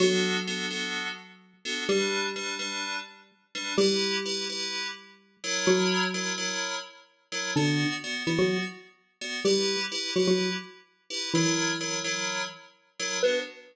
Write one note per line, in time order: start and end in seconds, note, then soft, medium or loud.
0.00 1.84 F#3 medium
0.00 0.37 B3 loud
0.00 0.37 D4 loud
0.00 0.37 F#4 loud
0.00 1.84 F#4 medium
0.00 0.37 A4 loud
0.47 0.66 B3 medium
0.47 0.66 D4 medium
0.47 0.66 F#4 medium
0.47 0.66 A4 loud
0.70 1.08 B3 medium
0.70 1.08 D4 medium
0.70 1.08 F#4 medium
0.70 1.08 A4 medium
1.65 1.84 B3 loud
1.65 1.84 D4 loud
1.65 1.84 F#4 loud
1.65 1.84 A4 medium
1.89 3.64 G3 medium
1.89 2.27 G3 loud
1.89 2.27 D4 loud
1.89 3.64 G4 medium
1.89 2.27 B4 loud
2.36 2.55 G3 medium
2.36 2.55 D4 medium
2.36 2.55 B4 loud
2.59 2.97 G3 medium
2.59 2.97 D4 loud
2.59 2.97 B4 loud
3.55 3.74 G3 medium
3.55 3.74 D4 loud
3.55 3.74 B4 medium
3.78 5.50 G3 medium
3.78 4.16 E4 loud
3.78 5.50 G4 loud
3.78 4.16 G4 loud
3.78 4.16 B4 loud
4.25 4.44 E4 loud
4.25 4.44 G4 loud
4.25 4.44 B4 loud
4.50 4.87 E4 loud
4.50 4.87 G4 loud
4.50 4.87 B4 medium
5.44 6.05 F#3 loud
5.44 6.05 E4 loud
5.44 6.05 A#4 loud
5.44 6.05 C#5 loud
5.67 6.44 F#3 medium
5.67 6.44 F#4 loud
6.14 6.33 F#3 medium
6.14 6.33 E4 medium
6.14 6.33 A#4 loud
6.14 6.33 C#5 loud
6.38 6.75 F#3 medium
6.38 6.75 E4 loud
6.38 6.75 A#4 loud
6.38 6.75 C#5 loud
7.32 7.51 F#3 medium
7.32 7.51 E4 loud
7.32 7.51 A#4 loud
7.32 7.51 C#5 medium
7.56 7.85 D3 medium
7.56 7.94 B3 loud
7.56 7.85 D4 loud
7.56 7.94 F#4 loud
7.56 7.94 D5 loud
8.04 8.23 B3 loud
8.04 8.23 F#4 medium
8.04 8.23 D5 loud
8.27 8.38 E3 medium
8.27 8.65 B3 medium
8.27 8.38 E4 medium
8.27 8.65 F#4 medium
8.27 8.65 D5 medium
8.39 8.58 F#3 medium
8.39 8.58 F#4 medium
9.21 9.40 B3 medium
9.21 9.40 F#4 medium
9.21 9.40 D5 loud
9.45 9.76 G3 medium
9.45 9.83 E4 loud
9.45 9.76 G4 medium
9.45 9.83 G4 loud
9.45 9.83 B4 loud
9.92 10.11 E4 loud
9.92 10.11 G4 loud
9.92 10.11 B4 loud
10.16 10.27 F#3 medium
10.16 10.54 E4 medium
10.16 10.27 F#4 medium
10.16 10.54 G4 medium
10.16 10.54 B4 medium
10.28 10.50 F#3 medium
10.28 10.50 F#4 medium
11.10 11.29 E4 loud
11.10 11.29 G4 medium
11.10 11.29 B4 loud
11.34 12.43 E3 medium
11.34 11.73 F#3 loud
11.34 12.43 E4 medium
11.34 11.73 E4 loud
11.34 11.73 A#4 loud
11.34 11.73 C#5 loud
11.81 12.00 F#3 medium
11.81 12.00 E4 medium
11.81 12.00 A#4 loud
11.81 12.00 C#5 loud
12.04 12.42 F#3 loud
12.04 12.42 E4 loud
12.04 12.42 A#4 loud
12.04 12.42 C#5 loud
13.00 13.18 F#3 loud
13.00 13.18 E4 medium
13.00 13.18 A#4 loud
13.00 13.18 C#5 loud
13.23 13.40 B3 loud
13.23 13.40 D4 medium
13.23 13.40 F#4 loud
13.23 13.39 B4 loud